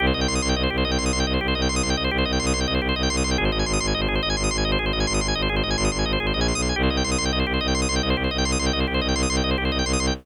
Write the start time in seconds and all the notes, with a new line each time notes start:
0.00 C2 G4
0.07 C5
0.14 C2 D#5
0.21 G5
0.28 C2 C6
0.35 D#6
0.42 C2 C6
0.49 G5
0.55 C2 D#5
0.63 C5
0.70 C2 G4
0.78 C5
0.85 C2 D#5
0.91 G5
0.98 C2 C6
1.06 D#6
1.12 C2 C6
1.20 G5
1.26 C2 D#5
1.34 C5
1.41 C2 G4
1.48 C5
1.55 C2 D#5
1.62 G5
1.69 C2 C6
1.76 D#6
1.83 C2 C6
1.90 G5
1.97 C2 D#5
2.04 C5
2.11 C2 G4
2.18 C5
2.25 C2 D#5
2.32 G5
2.39 C2 C6
2.46 D#6
2.54 C2 C6
2.61 G5
2.67 C2 D#5
2.75 C5
2.81 C2 G4
2.89 C5
2.96 C2 D#5
3.03 G5
3.10 C2 C6
3.17 D#6
3.24 C2 C6
3.31 G5
3.38 G#1 G#4
3.45 C5
3.51 G#1 D#5
3.59 G#5
3.66 G#1 C6
3.73 D#6
3.80 G#1 C6
3.87 G#5
3.94 G#1 D#5
4.01 C5
4.07 G#1 G#4
4.15 C5
4.23 G#1 D#5
4.30 G#5
4.37 G#1 C6
4.44 D#6
4.51 G#1 C6
4.58 G#5
4.65 G#1 D#5
4.72 C5
4.79 G#1 G#4
4.86 C5
4.93 G#1 D#5
5.00 G#5
5.07 G#1 C6
5.14 D#6
5.21 G#1 C6
5.28 G#5
5.35 G#1 D#5
5.42 C5
5.49 G#1 G#4
5.56 C5
5.63 G#1 D#5
5.70 G#5
5.77 G#1 C6
5.85 D#6
5.92 G#1 C6
5.99 G#5
6.05 G#1 D#5
6.13 C5
6.20 G#1 G#4
6.27 C5
6.33 A#1 D#5
6.41 G#5
6.48 C6
6.54 B1 D#6
6.62 C6
6.69 G#5
6.76 C2 G4
6.83 C5
6.90 C2 D#5
6.97 G5
7.04 C2 C6
7.11 D#6
7.18 C2 C6
7.25 G5
7.32 C2 D#5
7.39 C5
7.47 C2 G4
7.54 C5
7.61 C2 D#5
7.68 G5
7.74 C2 C6
7.82 D#6
7.89 C2 C6
7.96 G5
8.02 C2 D#5
8.10 C5
8.16 C2 G4
8.24 C5
8.31 C2 D#5
8.38 G5
8.45 C2 C6
8.52 D#6
8.59 C2 C6
8.66 G5
8.73 C2 D#5
8.80 C5
8.87 C2 G4
8.94 C5
9.01 C2 D#5
9.08 G5
9.14 C2 C6
9.23 D#6
9.29 C2 C6
9.37 G5
9.43 C2 D#5
9.51 C5
9.58 C2 G4
9.65 C5
9.71 C2 D#5
9.79 G5
9.85 C2 C6
9.93 D#6
9.99 C2 C6
10.07 G5